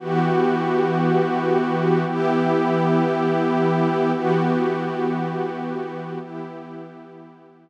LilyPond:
\new Staff { \time 4/4 \key e \dorian \tempo 4 = 58 <e b fis' g'>2 <e b e' g'>2 | <e b fis' g'>2 <e b e' g'>2 | }